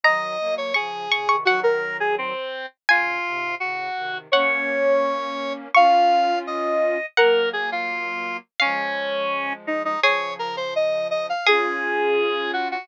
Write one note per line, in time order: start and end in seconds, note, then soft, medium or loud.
0.04 0.37 D#3 medium
0.04 0.37 F#3 medium
0.04 0.55 D#5 medium
0.04 0.63 A#5 loud
0.39 0.72 F#3 medium
0.39 0.72 A#3 medium
0.58 0.74 C#5 medium
0.74 1.08 C#3 medium
0.74 1.08 F3 medium
0.74 1.36 G#4 medium
0.74 1.07 C#6 medium
1.11 1.28 A#2 medium
1.11 1.28 C#3 medium
1.11 1.28 C#6 medium
1.28 1.45 C3 medium
1.28 1.45 D#3 medium
1.28 1.44 C#6 medium
1.45 2.33 D#3 medium
1.45 2.33 F#3 medium
1.45 1.60 F#4 medium
1.45 2.35 F#5 medium
1.63 1.97 A#4 medium
2.00 2.15 G#4 medium
2.18 2.66 C4 medium
2.89 3.19 A#2 medium
2.89 3.19 C#3 medium
2.89 3.55 F4 medium
2.89 4.23 G#5 loud
3.25 3.55 G#2 medium
3.25 3.55 C3 medium
3.60 3.89 A2 medium
3.60 3.89 C#3 medium
3.60 4.18 F#4 medium
3.96 4.28 C3 medium
3.96 4.28 D#3 medium
4.32 5.68 A#3 medium
4.32 5.68 C#4 medium
4.32 5.53 C#5 medium
4.32 5.59 F#5 loud
5.74 6.98 C#4 medium
5.74 6.98 F4 medium
5.74 6.39 F5 medium
5.74 7.04 C#6 medium
6.47 7.06 D#5 medium
7.17 8.39 F#3 medium
7.17 8.39 A#3 medium
7.17 7.49 A#4 medium
7.17 8.07 F#5 loud
7.53 7.70 G#4 medium
7.72 8.37 F4 medium
8.60 9.96 F3 medium
8.60 9.96 G#3 medium
8.60 9.53 C#4 medium
8.60 9.86 F5 loud
9.67 9.82 D#4 medium
9.85 10.00 D#4 medium
10.03 11.33 C#3 medium
10.03 11.33 F3 medium
10.03 10.80 G#4 loud
10.03 10.34 C#5 medium
10.39 10.56 A#4 medium
10.57 10.74 C5 medium
10.76 11.08 D#5 medium
11.11 11.26 D#5 medium
11.29 11.47 F5 medium
11.46 12.76 C#4 medium
11.46 12.76 F4 medium
11.46 12.68 G#4 loud
11.46 12.51 G#4 medium
12.53 12.68 F#4 medium
12.71 12.88 F#4 medium